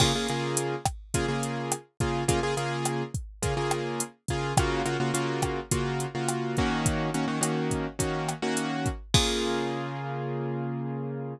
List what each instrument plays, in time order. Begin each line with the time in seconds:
0.00 acoustic grand piano C#3 A#3 F4 G#4, kick, cross-stick, crash
0.15 acoustic grand piano C#3 A#3 F4 G#4
0.28 acoustic grand piano C#3 A#3 F4 G#4, closed hi-hat
0.57 closed hi-hat
0.85 kick, cross-stick, closed hi-hat
1.14 acoustic grand piano C#3 A#3 F4 G#4, kick, closed hi-hat
1.28 acoustic grand piano C#3 A#3 F4 G#4
1.43 closed hi-hat
1.72 cross-stick, closed hi-hat
2.00 acoustic grand piano C#3 A#3 F4 G#4, kick, closed hi-hat
2.28 acoustic grand piano C#3 A#3 F4 G#4, kick, closed hi-hat
2.43 acoustic grand piano C#3 A#3 F4 G#4
2.57 acoustic grand piano C#3 A#3 F4 G#4, closed hi-hat
2.85 cross-stick, closed hi-hat
3.14 kick, closed hi-hat
3.43 acoustic grand piano C#3 A#3 F4 G#4, kick, closed hi-hat
3.57 acoustic grand piano C#3 A#3 F4 G#4
3.71 cross-stick, closed hi-hat
4.00 closed hi-hat
4.28 acoustic grand piano C#3 A#3 F4 G#4, kick, closed hi-hat
4.57 acoustic grand piano C#3 A#3 F4 F#4, kick, cross-stick, closed hi-hat
4.85 acoustic grand piano C#3 A#3 F4 F#4, closed hi-hat
5.00 acoustic grand piano C#3 A#3 F4 F#4
5.14 acoustic grand piano C#3 A#3 F4 F#4, closed hi-hat
5.42 kick, cross-stick, closed hi-hat
5.71 acoustic grand piano C#3 A#3 F4 F#4, kick, closed hi-hat
6.00 closed hi-hat
6.15 acoustic grand piano C#3 A#3 F4 F#4
6.29 cross-stick, closed hi-hat
6.57 acoustic grand piano D#3 A#3 C#4 F#4, kick, closed hi-hat
6.86 kick, closed hi-hat
7.14 acoustic grand piano D#3 A#3 C#4 F#4, closed hi-hat
7.28 acoustic grand piano D#3 A#3 C#4 F#4
7.41 acoustic grand piano D#3 A#3 C#4 F#4, cross-stick, closed hi-hat
7.71 kick, closed hi-hat
7.99 acoustic grand piano D#3 A#3 C#4 F#4, kick, closed hi-hat
8.29 cross-stick, closed hi-hat
8.42 acoustic grand piano D#3 A#3 C#4 F#4
8.57 closed hi-hat
8.86 kick, closed hi-hat
9.14 acoustic grand piano C#3 A#3 F4 G#4, kick, crash